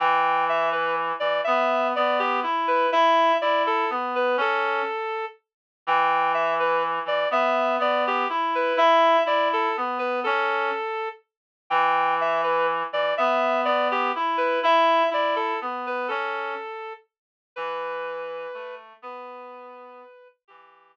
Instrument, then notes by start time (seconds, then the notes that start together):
clarinet
0.00 E3 G5
0.49 E5
0.72 B4
1.20 E3 D5
1.44 B3 E5
1.96 B3 D5
2.19 G4
2.43 E4
2.68 B4
2.92 E4 E5
3.41 E4 D5
3.67 A4
3.90 B3
4.15 B4
4.37 C#4 A4
5.87 E3 G5
6.34 E5
6.60 B4
7.05 E3 D5
7.31 B3 E5
7.79 B3 D5
8.07 G4
8.29 E4
8.55 B4
8.77 E4 E5
9.25 E4 D5
9.53 A4
9.77 B3
9.99 B4
10.24 C#4 A4
11.70 E3 G5
12.21 E5
12.43 B4
12.92 E3 D5
13.17 B3 E5
13.65 B3 D5
13.91 G4
14.16 E4
14.37 B4
14.63 E4 E5
15.10 E4 D5
15.36 A4
15.61 B3
15.87 B4
16.08 C#4 A4
17.56 E3 B4
18.54 A3
19.02 B3 B4
20.48 E3 G4